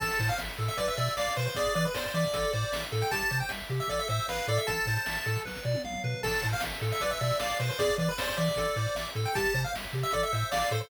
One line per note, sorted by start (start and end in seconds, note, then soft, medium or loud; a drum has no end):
0.00 0.11 A1 medium
0.00 0.18 A4 medium
0.00 0.28 A5 loud
0.00 kick loud
0.00 crash medium
0.11 closed hi-hat medium
0.19 0.30 A2 loud
0.19 0.37 C5 medium
0.19 kick medium
0.19 closed hi-hat medium
0.28 0.38 F5 loud
0.28 closed hi-hat medium
0.38 0.49 A1 medium
0.38 0.56 E5 medium
0.38 snare loud
0.49 closed hi-hat medium
0.58 0.69 A2 medium
0.58 0.76 A4 medium
0.58 closed hi-hat medium
0.68 0.78 E5 loud
0.68 closed hi-hat medium
0.77 0.88 B1 loud
0.77 0.95 B4 medium
0.77 0.87 D5 loud
0.77 kick medium
0.77 closed hi-hat loud
0.88 0.97 E5 loud
0.88 closed hi-hat medium
0.97 1.08 B2 medium
0.97 1.15 D5 medium
0.97 1.14 E5 loud
0.97 closed hi-hat medium
1.07 closed hi-hat medium
1.17 1.28 B1 medium
1.17 1.34 D5 loud
1.17 1.34 F5 medium
1.17 snare loud
1.27 closed hi-hat medium
1.36 1.48 B2 medium
1.36 1.54 B4 medium
1.36 1.46 C5 loud
1.36 closed hi-hat medium
1.46 1.56 C5 loud
1.46 closed hi-hat medium
1.55 1.66 E2 medium
1.55 1.73 G#4 medium
1.55 1.74 D5 loud
1.55 kick loud
1.55 closed hi-hat loud
1.65 closed hi-hat medium
1.74 1.86 E3 medium
1.74 1.93 B4 medium
1.74 1.84 D5 loud
1.74 closed hi-hat medium
1.85 1.95 B4 medium
1.85 closed hi-hat medium
1.94 2.06 E2 medium
1.94 2.04 C5 loud
1.94 2.12 D5 medium
1.94 snare loud
2.04 2.14 C5 medium
2.04 closed hi-hat medium
2.14 2.25 E3 medium
2.14 2.82 D5 loud
2.14 2.32 E5 medium
2.14 closed hi-hat medium
2.24 kick medium
2.24 closed hi-hat medium
2.34 2.45 A1 medium
2.34 2.51 A4 medium
2.34 kick medium
2.34 closed hi-hat loud
2.43 closed hi-hat medium
2.53 2.64 A2 medium
2.53 2.71 C5 medium
2.53 closed hi-hat medium
2.63 closed hi-hat medium
2.72 2.83 A1 medium
2.72 2.90 E5 medium
2.72 snare loud
2.81 closed hi-hat medium
2.92 3.03 A2 medium
2.92 3.10 A4 medium
2.92 closed hi-hat medium
3.01 3.11 G5 loud
3.01 closed hi-hat medium
3.11 3.22 C2 loud
3.11 3.29 G4 medium
3.11 3.38 A5 loud
3.11 kick loud
3.11 closed hi-hat loud
3.19 closed hi-hat medium
3.31 3.42 C3 medium
3.31 3.48 C5 medium
3.31 kick medium
3.31 closed hi-hat medium
3.40 3.50 G5 medium
3.40 closed hi-hat medium
3.49 3.61 C2 medium
3.49 3.68 E5 medium
3.49 snare loud
3.59 closed hi-hat medium
3.69 3.80 C3 medium
3.69 3.87 G4 medium
3.69 closed hi-hat medium
3.80 3.89 E5 loud
3.80 closed hi-hat medium
3.88 4.00 A1 medium
3.88 4.07 A4 medium
3.88 3.99 D5 medium
3.88 kick medium
3.88 closed hi-hat medium
3.99 4.08 E5 loud
3.99 closed hi-hat medium
4.08 4.20 A2 medium
4.08 4.26 C5 medium
4.08 4.27 E5 loud
4.08 closed hi-hat medium
4.20 closed hi-hat medium
4.28 4.39 A1 medium
4.28 4.47 B4 loud
4.28 4.46 F5 medium
4.28 snare loud
4.36 closed hi-hat medium
4.47 4.58 A2 medium
4.47 4.66 A4 medium
4.47 4.58 D5 loud
4.47 closed hi-hat medium
4.58 4.67 E5 loud
4.58 closed hi-hat medium
4.67 4.79 A1 medium
4.67 4.85 A4 medium
4.67 5.40 A5 loud
4.67 kick loud
4.67 closed hi-hat loud
4.79 closed hi-hat medium
4.85 4.98 A2 medium
4.85 5.04 C5 medium
4.85 kick medium
4.85 closed hi-hat medium
4.96 closed hi-hat medium
5.06 5.18 A1 medium
5.06 5.24 E5 medium
5.06 snare loud
5.15 closed hi-hat medium
5.26 5.37 A2 medium
5.26 5.43 A4 medium
5.26 closed hi-hat medium
5.36 kick medium
5.36 closed hi-hat medium
5.45 5.57 B1 medium
5.45 5.63 B4 medium
5.45 kick medium
5.45 snare medium
5.55 snare medium
5.65 5.76 B2 medium
5.65 5.82 D5 medium
5.74 high tom medium
5.84 5.95 B1 medium
5.84 6.02 F5 medium
5.84 mid tom medium
5.93 mid tom medium
6.04 6.14 B2 medium
6.04 6.22 B4 medium
6.04 floor tom medium
6.23 6.34 A1 medium
6.23 6.41 A4 medium
6.23 6.47 A5 loud
6.23 kick loud
6.23 crash loud
6.33 closed hi-hat medium
6.42 6.54 A2 medium
6.42 6.60 C5 medium
6.42 kick medium
6.42 closed hi-hat medium
6.51 6.62 F5 loud
6.51 closed hi-hat medium
6.60 6.73 A1 medium
6.60 6.80 E5 medium
6.60 snare loud
6.72 closed hi-hat medium
6.81 6.92 A2 medium
6.81 6.99 A4 medium
6.81 closed hi-hat medium
6.92 7.01 E5 loud
6.92 closed hi-hat medium
7.00 7.13 B1 medium
7.00 7.19 B4 medium
7.00 7.10 D5 loud
7.00 kick medium
7.00 closed hi-hat loud
7.11 7.20 E5 loud
7.11 closed hi-hat medium
7.21 7.32 B2 medium
7.21 7.38 D5 medium
7.21 7.39 E5 loud
7.21 closed hi-hat medium
7.31 closed hi-hat medium
7.40 7.51 B1 medium
7.40 7.58 D5 medium
7.40 7.58 F5 medium
7.40 snare loud
7.52 closed hi-hat medium
7.59 7.70 B2 medium
7.59 7.78 B4 medium
7.59 7.69 C5 medium
7.59 closed hi-hat medium
7.70 7.79 C5 loud
7.70 closed hi-hat medium
7.79 7.90 E2 medium
7.79 7.97 G#4 medium
7.79 7.95 D5 loud
7.79 kick loud
7.79 closed hi-hat loud
7.90 closed hi-hat medium
7.98 8.09 E3 medium
7.98 8.17 B4 medium
7.98 8.09 D5 medium
7.98 kick medium
7.98 closed hi-hat medium
8.09 8.18 B4 loud
8.09 closed hi-hat medium
8.18 8.29 E2 medium
8.18 8.27 C5 loud
8.18 8.36 D5 medium
8.18 snare loud
8.28 8.37 C5 loud
8.28 closed hi-hat medium
8.37 8.49 E3 medium
8.37 9.07 D5 loud
8.37 8.55 E5 medium
8.37 closed hi-hat medium
8.48 kick medium
8.48 closed hi-hat medium
8.56 8.67 A1 loud
8.56 8.75 A4 medium
8.56 kick loud
8.56 closed hi-hat loud
8.66 closed hi-hat medium
8.76 8.87 A2 medium
8.76 8.94 C5 medium
8.76 closed hi-hat medium
8.86 closed hi-hat medium
8.95 9.06 A1 medium
8.95 9.13 E5 medium
8.95 snare loud
9.08 closed hi-hat medium
9.15 9.26 A2 medium
9.15 9.33 A4 medium
9.15 closed hi-hat medium
9.25 9.35 G5 loud
9.25 closed hi-hat medium
9.35 9.46 C2 loud
9.35 9.53 G4 medium
9.35 9.61 A5 loud
9.35 kick loud
9.35 closed hi-hat loud
9.45 closed hi-hat medium
9.54 9.65 C3 medium
9.54 9.72 C5 medium
9.54 kick medium
9.54 closed hi-hat medium
9.64 9.74 F5 medium
9.64 closed hi-hat medium
9.74 9.85 C2 medium
9.74 9.92 E5 medium
9.74 snare loud
9.84 closed hi-hat medium
9.93 10.04 C3 medium
9.93 10.11 G4 medium
9.93 closed hi-hat medium
10.03 10.13 E5 loud
10.03 closed hi-hat medium
10.11 10.23 A1 medium
10.11 10.31 A4 medium
10.11 10.22 D5 loud
10.11 kick medium
10.11 closed hi-hat loud
10.23 10.32 E5 loud
10.23 closed hi-hat medium
10.32 10.44 A2 medium
10.32 10.50 C5 medium
10.32 10.50 E5 medium
10.32 closed hi-hat medium
10.41 closed hi-hat medium
10.51 10.63 A1 medium
10.51 10.70 D5 loud
10.51 10.70 F5 medium
10.51 snare loud
10.62 closed hi-hat medium
10.71 10.82 A2 medium
10.71 10.89 A4 medium
10.71 10.80 C5 loud
10.71 closed hi-hat medium
10.81 10.89 C5 loud
10.81 closed hi-hat medium